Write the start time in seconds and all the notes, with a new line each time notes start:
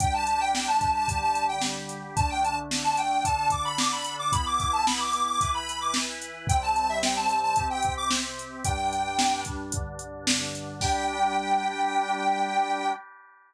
0.00 G3 D4 G4 G5, kick, closed hi-hat
0.14 A5
0.27 A5, closed hi-hat
0.41 G5
0.54 G5, snare
0.68 A5
0.81 kick, closed hi-hat
0.95 A5
1.08 D3 G3 G4, kick, closed hi-hat
1.22 A5
1.35 closed hi-hat
1.49 G5
1.61 snare
1.89 closed hi-hat
2.16 D3 A3 D4 A5, kick, closed hi-hat
2.30 G5
2.43 A5, closed hi-hat
2.71 snare
2.84 A5
2.97 G5, closed hi-hat
3.24 D3 D4 A4 A5, kick, closed hi-hat
3.50 D6, kick, closed hi-hat
3.65 B5
3.78 D6, snare
3.92 B5
4.05 closed hi-hat
4.19 D6
4.32 E3 B3 E4 B5, kick, closed hi-hat
4.46 D6
4.59 D6, kick, closed hi-hat
4.73 A5
4.86 B5, snare
5.00 D6
5.13 closed hi-hat
5.27 D6
5.41 E3 E4 B4, kick, closed hi-hat
5.54 B5
5.69 closed hi-hat
5.81 D6
5.94 snare
6.22 closed hi-hat
6.47 C3 G3 C4 G5, kick, closed hi-hat
6.62 A5
6.76 A5, closed hi-hat
6.89 E5
7.03 G5, snare
7.16 A5
7.29 closed hi-hat
7.43 A5
7.56 C3 C4 G4, kick, closed hi-hat
7.70 G5
7.83 kick, closed hi-hat
7.97 D6
8.11 snare
8.39 closed hi-hat
8.65 G2 G3 D4 G5, kick, closed hi-hat
8.93 closed hi-hat
9.19 snare
9.45 kick, closed hi-hat
9.72 G2 D3 D4, kick, closed hi-hat
9.99 closed hi-hat
10.27 snare
10.55 closed hi-hat
10.81 G3 D4 G4 G5, kick, crash